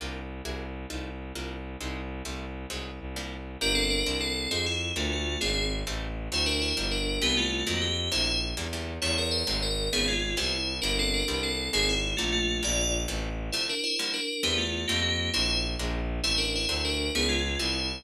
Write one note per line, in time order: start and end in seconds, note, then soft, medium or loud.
0.00 0.41 C2 medium
0.00 0.22 A#3 medium
0.00 0.22 D4 medium
0.00 0.22 F4 medium
0.00 0.22 G4 medium
0.44 0.86 C2 loud
0.44 0.66 A#3 medium
0.44 0.66 E4 medium
0.44 0.66 F#4 medium
0.44 0.66 G#4 medium
0.90 1.32 C2 medium
0.90 1.11 A3 medium
0.90 1.11 C4 medium
0.90 1.11 D#4 medium
0.90 1.11 F4 medium
1.35 1.76 C2 medium
1.35 1.56 G3 medium
1.35 1.56 A#3 medium
1.35 1.56 D4 medium
1.35 1.56 F4 medium
1.80 2.22 C2 loud
1.80 2.02 G3 medium
1.80 2.02 G#3 medium
1.80 2.02 C4 medium
1.80 2.02 D#4 medium
2.24 2.66 C2 loud
2.24 2.46 G3 medium
2.24 2.46 A3 medium
2.24 2.46 C4 medium
2.24 2.46 E4 medium
2.70 2.99 C2 medium
2.70 2.91 F#3 medium
2.70 2.91 G#3 medium
2.70 2.91 C4 medium
2.70 2.91 D#4 medium
3.00 3.57 C2 medium
3.16 3.37 F3 medium
3.16 3.37 G3 medium
3.16 3.37 A#3 medium
3.16 3.37 D4 medium
3.61 4.03 G1 loud
3.61 3.82 A#3 loud
3.61 3.82 D4 loud
3.61 3.75 D4 medium
3.61 3.82 F4 medium
3.61 3.82 G4 loud
3.61 3.75 A#4 loud
3.75 3.89 C4 medium
3.75 3.89 A4 medium
3.90 4.16 D4 medium
3.90 4.16 A#4 medium
4.06 4.47 C2 loud
4.06 4.27 A#3 medium
4.06 4.27 C4 loud
4.06 4.27 D4 loud
4.06 4.27 E4 medium
4.20 4.48 C4 medium
4.20 4.48 A4 medium
4.51 4.92 F2 medium
4.51 4.72 G#3 medium
4.51 4.64 C4 medium
4.51 4.72 C4 medium
4.51 4.72 D#4 loud
4.51 4.72 F4 medium
4.51 4.64 G#4 medium
4.66 4.91 E4 medium
4.95 5.37 D2 loud
4.95 5.17 A3 loud
4.95 5.10 A3 medium
4.95 5.17 A#3 loud
4.95 5.17 C4 loud
4.95 5.17 D4 loud
4.95 5.10 F4 medium
5.12 5.38 A3 medium
5.12 5.38 F4 medium
5.41 5.83 G#1 loud
5.41 5.62 G#3 loud
5.41 5.66 C4 medium
5.41 5.62 C4 loud
5.41 5.62 D4 loud
5.41 5.62 F4 medium
5.41 5.66 G#4 medium
5.87 6.29 A1 loud
5.87 6.08 G3 loud
5.87 6.08 A3 loud
5.87 6.08 C4 loud
5.87 6.08 E4 loud
6.31 6.73 D2 loud
6.31 6.53 F#3 loud
6.31 6.53 A3 loud
6.31 6.53 C4 loud
6.31 6.53 D4 medium
6.31 6.45 E4 medium
6.31 6.45 C5 medium
6.46 6.59 D4 medium
6.46 6.59 A#4 medium
6.62 6.86 E4 medium
6.62 6.86 C5 medium
6.77 7.19 G1 loud
6.77 6.98 F3 medium
6.77 6.98 G3 loud
6.77 6.98 A#3 medium
6.77 6.98 D4 loud
6.91 7.21 D4 medium
6.91 7.21 A#4 medium
7.22 7.63 C2 loud
7.22 7.43 E3 loud
7.22 7.43 G3 loud
7.22 7.43 B3 loud
7.22 7.36 B3 medium
7.22 7.43 C4 medium
7.22 7.36 G4 loud
7.37 7.64 A3 medium
7.37 7.64 F4 medium
7.67 8.09 F2 loud
7.67 7.88 D#3 loud
7.67 7.88 F3 loud
7.67 7.88 F#3 loud
7.67 7.88 A3 medium
7.67 7.81 A#3 medium
7.67 7.81 F#4 medium
7.81 8.08 G4 medium
8.12 8.54 A#1 loud
8.12 8.33 C3 loud
8.12 8.33 D3 loud
8.12 8.33 A3 medium
8.12 8.33 A#3 loud
8.12 8.39 E4 medium
8.12 8.39 C5 medium
8.57 8.98 E2 loud
8.57 8.68 D3 loud
8.57 8.68 E3 medium
8.57 8.68 G3 medium
8.57 8.68 A#3 loud
8.73 8.94 D3 medium
8.73 8.94 E3 medium
8.73 8.94 G3 medium
8.73 8.94 A#3 medium
9.02 9.43 E2 loud
9.02 9.23 C#3 loud
9.02 9.23 G3 loud
9.02 9.23 A3 loud
9.02 9.23 B3 loud
9.02 9.16 E4 medium
9.02 9.16 C#5 medium
9.18 9.33 A#4 medium
9.31 9.60 C5 medium
9.47 9.89 G#1 loud
9.47 9.68 C3 loud
9.47 9.68 F#3 loud
9.47 9.68 G#3 medium
9.47 9.68 A3 medium
9.62 9.88 A#4 medium
9.93 10.35 G#1 medium
9.93 10.14 C#3 loud
9.93 10.14 D#3 loud
9.93 10.14 F3 loud
9.93 10.14 B3 loud
9.93 10.07 B3 medium
9.93 10.07 G#4 loud
10.08 10.35 G#3 medium
10.08 10.35 F4 medium
10.37 10.80 C2 loud
10.37 10.58 C3 loud
10.37 10.58 E3 medium
10.37 10.58 G3 loud
10.37 10.58 B3 loud
10.37 10.75 E4 medium
10.37 10.75 C5 medium
10.82 11.23 G1 loud
10.82 11.04 F3 medium
10.82 11.04 G3 loud
10.82 11.04 A#3 loud
10.82 10.96 D4 medium
10.82 11.04 D4 loud
10.82 10.96 A#4 medium
10.99 11.13 C4 medium
10.99 11.13 A4 medium
11.14 11.41 D4 medium
11.14 11.41 A#4 medium
11.28 11.69 C2 loud
11.28 11.49 E3 medium
11.28 11.49 G3 loud
11.28 11.49 B3 medium
11.28 11.49 C4 medium
11.43 11.68 C4 medium
11.43 11.68 A4 medium
11.73 12.14 G#1 loud
11.73 11.94 D#3 loud
11.73 11.94 G#3 loud
11.73 11.94 A#3 loud
11.73 11.94 C4 loud
11.73 11.87 C4 loud
11.73 11.87 G#4 loud
11.89 12.14 E4 medium
12.17 12.60 A#1 medium
12.17 12.39 D3 medium
12.17 12.31 A3 medium
12.17 12.39 A3 loud
12.17 12.39 A#3 loud
12.17 12.39 C4 medium
12.17 12.31 F4 medium
12.32 12.57 A3 medium
12.32 12.57 F4 medium
12.63 13.06 A#1 loud
12.63 12.84 D3 medium
12.63 12.84 G3 medium
12.63 12.84 G#3 loud
12.63 12.84 A#3 medium
12.63 12.93 F4 medium
12.63 12.93 D5 loud
13.08 13.50 A1 loud
13.08 13.29 C3 loud
13.08 13.29 E3 loud
13.08 13.29 G3 medium
13.08 13.29 A3 loud
13.52 13.74 C3 loud
13.52 13.74 D3 loud
13.52 13.74 F3 medium
13.52 13.74 A3 loud
13.52 13.65 E4 medium
13.52 13.65 C5 medium
13.69 13.83 D4 medium
13.69 13.83 A#4 medium
13.84 14.12 E4 medium
13.84 14.12 C5 medium
13.99 14.20 D3 loud
13.99 14.20 F3 loud
13.99 14.20 G3 loud
13.99 14.20 A#3 medium
14.13 14.42 D4 medium
14.13 14.42 A#4 medium
14.43 14.85 E2 loud
14.43 14.64 E3 medium
14.43 14.64 G3 loud
14.43 14.64 B3 loud
14.43 14.57 B3 medium
14.43 14.64 C4 loud
14.43 14.57 G4 medium
14.58 14.85 A3 medium
14.58 14.85 F4 medium
14.88 15.30 F2 loud
14.88 15.10 F3 loud
14.88 15.10 G3 loud
14.88 15.10 A3 loud
14.88 15.00 A#3 medium
14.88 15.10 C4 medium
14.88 15.00 G4 medium
15.02 15.29 A#3 medium
15.02 15.29 G4 medium
15.33 15.76 A#1 loud
15.33 15.55 A3 loud
15.33 15.55 A#3 loud
15.33 15.55 C4 loud
15.33 15.55 D4 medium
15.33 15.59 E4 medium
15.33 15.59 C5 medium
15.79 16.20 A#1 loud
15.79 16.00 G3 medium
15.79 16.00 G#3 medium
15.79 16.00 A#3 loud
15.79 16.00 D4 loud
16.23 16.66 A1 medium
16.23 16.45 G3 loud
16.23 16.45 A3 loud
16.23 16.45 C4 loud
16.23 16.37 E4 medium
16.23 16.45 E4 loud
16.23 16.37 C5 loud
16.38 16.51 D4 medium
16.38 16.51 A#4 medium
16.55 16.83 E4 medium
16.55 16.83 C5 medium
16.69 17.10 D2 loud
16.69 16.90 F#3 loud
16.69 16.90 A3 loud
16.69 16.90 C4 loud
16.69 16.90 D4 loud
16.85 17.09 D4 medium
16.85 17.09 A#4 medium
17.15 17.56 C#2 loud
17.15 17.36 F3 medium
17.15 17.36 B3 loud
17.15 17.28 B3 medium
17.15 17.36 C#4 loud
17.15 17.36 D#4 loud
17.15 17.28 G#4 loud
17.29 17.56 G#3 medium
17.29 17.56 F4 medium
17.59 18.01 C2 loud
17.59 17.81 E3 loud
17.59 17.81 G3 loud
17.59 17.81 B3 medium
17.59 17.81 C4 medium
17.59 18.02 E4 medium
17.59 18.02 C5 medium